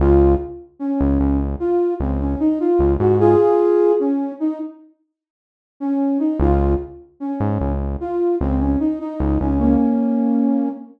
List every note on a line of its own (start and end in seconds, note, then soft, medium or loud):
0.00 0.36 C#2 loud
0.00 0.34 F4 loud
0.79 1.37 C#4 medium
1.01 1.19 C#2 medium
1.20 1.56 C#2 medium
1.60 1.94 F4 medium
2.00 2.36 C#2 medium
2.00 2.20 C4 medium
2.20 2.39 C#4 medium
2.40 2.59 D#4 loud
2.60 2.93 F4 medium
2.79 2.97 C#2 medium
2.99 3.36 G#2 medium
2.99 3.18 F#4 medium
3.20 3.92 F4 loud
3.20 3.92 G#4 loud
4.00 4.32 C#4 medium
4.40 4.59 D#4 medium
5.80 6.18 C#4 medium
6.19 6.38 D#4 medium
6.40 6.76 C#2 loud
6.40 6.73 F4 medium
7.20 7.71 C#4 medium
7.40 7.58 G#2 medium
7.61 7.97 C#2 medium
8.00 8.35 F4 medium
8.41 8.77 C#2 medium
8.41 8.60 C4 loud
8.60 8.79 C#4 medium
8.80 8.99 D#4 medium
9.00 9.39 D#4 medium
9.20 9.38 C#2 medium
9.40 9.77 C#2 medium
9.40 9.59 C#4 medium
9.59 10.69 A#3 medium
9.59 10.69 C#4 medium